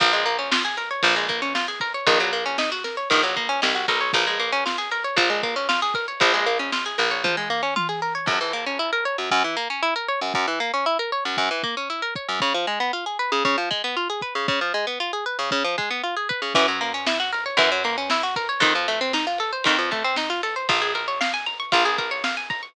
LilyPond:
<<
  \new Staff \with { instrumentName = "Acoustic Guitar (steel)" } { \time 4/4 \key bes \minor \tempo 4 = 116 f16 aes16 bes16 des'16 f'16 aes'16 bes'16 des''16 f16 aes16 bes16 des'16 f'16 aes'16 bes'16 des''16 | ees16 ges16 bes16 des'16 ees'16 ges'16 bes'16 des''16 ees16 ges16 bes16 des'16 ees'16 ges'16 bes'16 des''16 | f16 aes16 bes16 des'16 f'16 aes'16 bes'16 des''16 f16 aes16 bes16 des'16 f'16 aes'16 bes'16 des''16 | f16 aes16 bes16 des'16 f'16 aes'16 bes'16 des''16 f16 aes16 bes16 des'16 f'16 aes'16 bes'16 des''16 |
\key des \major ges,16 fes16 bes16 des'16 fes'16 bes'16 des''16 ges,16 ges,16 fes16 bes16 des'16 fes'16 bes'16 des''16 ges,16 | ges,16 fes16 bes16 des'16 fes'16 bes'16 des''16 ges,16 ges,16 fes16 bes16 des'16 fes'16 bes'16 des''16 ges,16 | des16 f16 aes16 ces'16 f'16 aes'16 ces''16 des16 des16 f16 aes16 ces'16 f'16 aes'16 ces''16 des16 | des16 f16 aes16 ces'16 f'16 aes'16 ces''16 des16 des16 f16 aes16 ces'16 f'16 aes'16 ces''16 des16 |
\key bes \minor fes16 ges16 bes16 des'16 fes'16 ges'16 bes'16 des''16 fes16 ges16 bes16 des'16 fes'16 ges'16 bes'16 des''16 | ees16 f16 a16 c'16 ees'16 f'16 a'16 c''16 ees16 f16 a16 c'16 ees'16 f'16 a'16 c''16 | f'16 aes'16 bes'16 des''16 f''16 aes''16 bes''16 des'''16 f'16 aes'16 bes'16 des''16 f''16 aes''16 bes''16 des'''16 | }
  \new Staff \with { instrumentName = "Electric Bass (finger)" } { \clef bass \time 4/4 \key bes \minor bes,,2 bes,,2 | bes,,2 bes,,4 c,8 b,,8 | bes,,2 bes,,2 | bes,,4. bes,,2~ bes,,8 |
\key des \major r1 | r1 | r1 | r1 |
\key bes \minor ges,2 ges,2 | f,2 f,2 | bes,,2 bes,,2 | }
  \new DrumStaff \with { instrumentName = "Drums" } \drummode { \time 4/4 <bd cymr>8 cymr8 sn8 cymr8 <bd cymr>8 <bd cymr>8 sn8 <bd cymr>8 | <bd cymr>8 cymr8 sn8 sn8 <bd cymr>8 <bd cymr>8 sn8 <bd cymr>8 | <bd cymr>8 cymr8 sn8 cymr8 <bd cymr>8 <bd cymr>8 sn8 <bd cymr>8 | <bd cymr>8 cymr8 sn8 cymr8 <bd tommh>8 tomfh8 tommh4 |
<cymc bd>4 r4 bd4 r4 | bd4 r4 bd8 bd8 r8 bd8 | bd4 r4 bd8 bd8 r8 bd8 | bd4 r4 bd8 bd8 r8 bd8 |
<bd cymr>8 cymr8 sn8 cymr8 <bd cymr>8 cymr8 sn8 <bd cymr>8 | <bd cymr>8 cymr8 sn8 cymr8 <bd cymr>8 <bd cymr>8 sn8 cymr8 | <bd cymr>8 cymr8 sn8 cymr8 <bd cymr>8 <bd cymr>8 sn8 <bd cymr>8 | }
>>